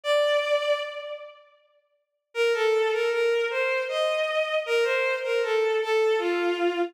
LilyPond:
\new Staff { \time 3/4 \key bes \major \tempo 4 = 78 d''4 r2 | bes'16 a'8 bes'16 bes'8 c''8 ees''4 | bes'16 c''8 bes'16 a'8 a'8 f'4 | }